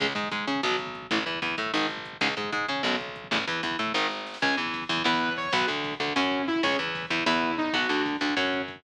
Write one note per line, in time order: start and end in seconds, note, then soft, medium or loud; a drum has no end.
0.00 0.14 C#2 medium
0.00 0.06 C#3 loud
0.00 0.06 G#3 loud
0.00 kick loud
0.00 crash loud
0.08 kick medium
0.15 0.29 G#2 medium
0.15 0.28 G#3 soft
0.15 kick medium
0.15 closed hi-hat medium
0.24 kick medium
0.31 0.45 G#2 medium
0.31 0.46 G#3 soft
0.31 kick medium
0.31 closed hi-hat loud
0.39 kick medium
0.47 0.61 C#3 medium
0.47 0.61 C#4 medium
0.47 kick medium
0.47 closed hi-hat medium
0.55 kick medium
0.63 1.07 B1 medium
0.63 0.76 B2 medium
0.63 0.76 F#3 loud
0.63 kick medium
0.63 snare loud
0.72 kick medium
0.78 kick medium
0.78 closed hi-hat medium
0.87 kick medium
0.95 kick medium
0.95 closed hi-hat medium
1.02 kick medium
1.11 1.24 A1 medium
1.11 1.18 A2 medium
1.11 1.18 E3 medium
1.11 kick medium
1.11 closed hi-hat loud
1.18 kick medium
1.26 1.40 E2 soft
1.26 1.39 E3 soft
1.26 kick medium
1.26 closed hi-hat medium
1.34 kick medium
1.42 1.55 E2 medium
1.42 1.56 E3 soft
1.42 kick medium
1.42 closed hi-hat medium
1.50 kick medium
1.57 1.71 A2 medium
1.57 1.72 A3 medium
1.57 kick medium
1.57 closed hi-hat medium
1.66 kick medium
1.73 2.17 G#1 medium
1.73 1.86 G#2 loud
1.73 1.86 D#3 loud
1.73 kick medium
1.73 snare loud
1.82 kick medium
1.89 kick medium
1.89 closed hi-hat medium
1.97 kick medium
2.05 kick medium
2.05 closed hi-hat medium
2.13 kick medium
2.21 2.34 C#2 medium
2.21 2.28 G#2 loud
2.21 2.28 C#3 medium
2.21 kick medium
2.21 closed hi-hat loud
2.29 kick medium
2.37 2.50 G#2 medium
2.37 2.51 G#3 soft
2.37 kick medium
2.37 closed hi-hat medium
2.44 kick medium
2.52 2.66 G#2 medium
2.52 2.67 G#3 medium
2.52 kick medium
2.52 closed hi-hat medium
2.61 kick medium
2.68 2.82 C#3 medium
2.68 2.83 C#4 medium
2.68 kick medium
2.68 closed hi-hat medium
2.76 kick medium
2.83 3.28 B1 medium
2.83 2.96 F#2 medium
2.83 2.96 B2 loud
2.83 kick medium
2.83 snare medium
2.93 kick medium
3.00 kick medium
3.00 closed hi-hat medium
3.08 kick medium
3.16 kick medium
3.16 closed hi-hat medium
3.24 kick medium
3.31 3.45 A1 medium
3.31 3.37 E2 loud
3.31 3.37 A2 loud
3.31 kick medium
3.31 closed hi-hat loud
3.40 kick medium
3.47 3.61 E2 medium
3.47 3.62 E3 medium
3.47 kick medium
3.47 closed hi-hat medium
3.63 3.76 E2 medium
3.63 3.77 E3 medium
3.63 kick medium
3.63 closed hi-hat loud
3.71 kick medium
3.79 3.92 A2 medium
3.79 3.93 A3 medium
3.79 kick medium
3.79 closed hi-hat medium
3.87 kick medium
3.94 4.38 G#1 medium
3.94 4.07 G#2 medium
3.94 4.07 D#3 medium
3.94 kick medium
3.94 snare medium
4.10 snare medium
4.26 snare medium
4.34 snare loud
4.42 4.56 C#2 medium
4.42 4.57 C#4 medium
4.42 4.57 G#4 medium
4.42 4.55 G#5 medium
4.42 kick loud
4.42 crash medium
4.50 kick medium
4.57 4.85 E2 medium
4.57 4.84 E3 medium
4.57 kick medium
4.57 ride medium
4.66 kick medium
4.74 kick medium
4.74 ride loud
4.82 kick medium
4.89 5.03 E2 medium
4.89 5.03 E3 medium
4.89 kick medium
4.89 ride medium
4.97 kick medium
5.04 5.49 E2 medium
5.04 5.30 B3 medium
5.04 5.30 E4 medium
5.04 5.33 B4 medium
5.04 kick medium
5.04 snare loud
5.13 kick medium
5.21 kick medium
5.21 ride medium
5.29 kick medium
5.36 5.52 C#5 medium
5.36 kick medium
5.36 ride medium
5.45 kick medium
5.53 5.66 B1 medium
5.53 5.68 B3 medium
5.53 5.68 F#4 medium
5.53 5.66 B4 medium
5.53 kick medium
5.53 ride loud
5.61 kick medium
5.67 5.95 D2 medium
5.67 5.94 D3 medium
5.67 kick medium
5.67 ride medium
5.76 kick medium
5.84 kick medium
5.84 ride medium
5.92 kick medium
6.00 6.13 D2 medium
6.00 6.13 D3 medium
6.00 kick medium
6.00 ride medium
6.08 kick medium
6.15 6.60 F#2 medium
6.15 6.45 C#4 medium
6.15 6.42 C#4 medium
6.15 6.42 F#4 medium
6.15 kick medium
6.15 snare loud
6.24 kick medium
6.31 kick medium
6.31 ride medium
6.39 kick medium
6.47 6.62 E4 medium
6.47 kick medium
6.47 ride medium
6.56 kick medium
6.63 6.77 C#2 medium
6.63 6.78 C#4 medium
6.63 6.78 G#4 medium
6.63 6.77 C#5 medium
6.63 kick loud
6.63 ride loud
6.71 kick medium
6.79 7.06 E2 medium
6.79 7.06 E3 medium
6.79 kick medium
6.79 ride medium
6.87 kick medium
6.95 kick medium
6.95 ride loud
7.03 kick medium
7.10 7.24 E2 medium
7.10 7.24 E3 medium
7.10 kick medium
7.10 ride medium
7.19 kick medium
7.26 7.70 E2 medium
7.26 7.52 B3 medium
7.26 7.52 E4 medium
7.26 7.55 E4 medium
7.26 kick medium
7.26 snare loud
7.34 kick medium
7.42 kick medium
7.42 ride medium
7.50 kick medium
7.58 7.72 D#4 medium
7.58 kick loud
7.58 ride medium
7.66 kick medium
7.73 7.87 B1 medium
7.73 7.88 B3 medium
7.73 7.88 F#4 medium
7.73 8.02 F#4 medium
7.73 kick loud
7.73 ride loud
7.82 kick medium
7.89 8.16 D2 medium
7.89 8.17 D3 medium
7.89 kick medium
7.89 ride medium
7.97 kick medium
8.06 kick medium
8.06 ride loud
8.13 kick medium
8.21 8.34 D2 medium
8.21 8.35 D3 medium
8.21 kick medium
8.21 ride medium
8.29 kick medium
8.37 8.80 F#2 medium
8.37 8.62 C#4 medium
8.37 8.62 F#4 medium
8.37 kick medium
8.37 snare loud
8.45 kick medium
8.53 kick medium
8.53 ride medium
8.61 kick medium
8.68 kick medium
8.68 ride medium
8.76 kick medium